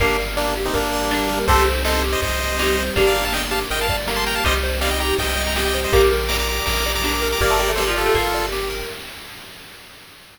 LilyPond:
<<
  \new Staff \with { instrumentName = "Lead 1 (square)" } { \time 4/4 \key g \minor \tempo 4 = 162 <bes d'>8 r8 <bes d'>8 r16 <c' ees'>16 <bes d'>2 | <a' c''>8 r8 <a' c''>8 r16 <c'' ees''>16 <c'' ees''>2 | r16 <d'' f''>8 <f'' a''>16 <ees'' g''>16 r16 <f'' a''>16 r16 <ees'' g''>16 <f'' a''>8 r8 <a'' c'''>16 <g'' bes''>16 <f'' a''>16 | <c'' ees''>16 r8. <d'' f''>16 <ees'' g''>16 <g'' bes''>8 <ees'' g''>8. <g'' bes''>16 <ees'' g''>16 <ees'' g''>8 <c'' ees''>16 |
<bes'' d'''>16 r8. <bes'' d'''>16 <bes'' d'''>16 <bes'' d'''>8 <bes'' d'''>8. <bes'' d'''>16 <bes'' d'''>16 <bes'' d'''>8 <bes'' d'''>16 | <bes' d''>4 <a' c''>16 r16 <f' a'>4. r4 | }
  \new Staff \with { instrumentName = "Pizzicato Strings" } { \time 4/4 \key g \minor <g bes>2. d'4 | <a c'>2. ees'4 | <bes d'>2. bes4 | <ees g>4 g4 r2 |
<g bes>2. d'4 | bes16 a16 g16 a16 g16 f8 a16 bes8 r4. | }
  \new Staff \with { instrumentName = "Lead 1 (square)" } { \time 4/4 \key g \minor g'8 bes'8 d''8 g'8 bes'8 d''8 g'8 bes'8 | g'8 c''8 ees''8 g'8 c''8 ees''8 g'8 c''8 | g'8 bes'8 d''8 g'8 bes'8 d''8 g'8 bes'8 | g'8 c''8 ees''8 g'8 c''8 ees''8 g'8 c''8 |
g'8 bes'8 d''8 g'8 bes'8 d''8 g'8 bes'8 | g'8 bes'8 d''8 g'8 bes'8 d''8 g'8 bes'8 | }
  \new Staff \with { instrumentName = "Synth Bass 1" } { \clef bass \time 4/4 \key g \minor g,,2 g,,2 | c,2 c,2 | g,,2 g,,2 | c,2 c,2 |
bes,,2 bes,,2 | g,,2 g,,2 | }
  \new Staff \with { instrumentName = "Pad 2 (warm)" } { \time 4/4 \key g \minor <bes d' g'>2 <g bes g'>2 | <c' ees' g'>2 <g c' g'>2 | <bes d' g'>2 <g bes g'>2 | <c' ees' g'>2 <g c' g'>2 |
<bes' d'' g''>2 <g' bes' g''>2 | <bes' d'' g''>2 <g' bes' g''>2 | }
  \new DrumStaff \with { instrumentName = "Drums" } \drummode { \time 4/4 <bd cymr>8 cymr8 sn8 cymr8 <bd cymr>8 cymr8 sn8 cymr8 | <bd cymr>8 cymr8 sn8 cymr8 <bd cymr>8 cymr8 sn8 cymr8 | <bd cymr>8 cymr8 sn8 cymr8 cymr8 <bd cymr>8 sn8 cymr8 | <bd cymr>8 cymr8 sn8 cymr8 <bd cymr>8 cymr8 sn8 cymr8 |
<bd cymr>8 cymr8 sn8 cymr8 <bd cymr>8 cymr8 sn8 cymr8 | <bd cymr>8 cymr8 sn4 <bd cymr>8 cymr8 sn8 cymr8 | }
>>